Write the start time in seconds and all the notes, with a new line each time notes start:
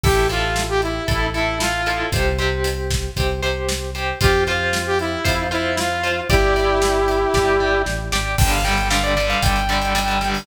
0.03 A1 E4 G4 A4, kick, crash
0.29 E4 F4 A4, closed hi-hat
0.56 snare
0.69 G4
0.82 E4, closed hi-hat
1.08 A1 E4 A4, kick, closed hi-hat
1.34 E4 A4, closed hi-hat
1.60 F4, snare
1.86 E4 A4, closed hi-hat
2.12 C2 G4 C5, kick, closed hi-hat
2.38 G4 C5, closed hi-hat
2.64 closed hi-hat
2.91 kick, snare
3.17 C2 G4 C5, kick, closed hi-hat
3.42 G4 C5, closed hi-hat
3.69 snare
3.95 G4 C5, closed hi-hat
4.21 F2 F4 G4 C5, kick, closed hi-hat
4.47 F4 C5, closed hi-hat
4.73 snare
4.86 G4
4.99 E4, closed hi-hat
5.24 F2 F4 C5, kick, closed hi-hat
5.51 E4 F4 C5, closed hi-hat
5.77 F4, snare
6.03 F4 C5, closed hi-hat
6.30 G1 E4 G4 D5, kick, closed hi-hat
6.56 G4 D5, closed hi-hat
6.82 snare
7.08 closed hi-hat
7.34 G1 G4 D5, kick, snare
7.60 G4 D5
7.86 A1, snare
8.12 G#1 G4 D5, snare
8.38 G1 D3 G3 G5, kick, crash
8.51 F5, closed hi-hat
8.64 D3 G3 G5, closed hi-hat
8.77 closed hi-hat
8.90 D3 G3 F5, snare
9.04 D5, closed hi-hat
9.17 D3 G3, closed hi-hat
9.30 F5, closed hi-hat
9.42 G1 G5, kick, closed hi-hat
9.56 closed hi-hat
9.69 D3 G3, closed hi-hat
9.82 closed hi-hat
9.95 D3 G3, closed hi-hat
10.08 closed hi-hat
10.21 D3 G3, closed hi-hat
10.34 open hi-hat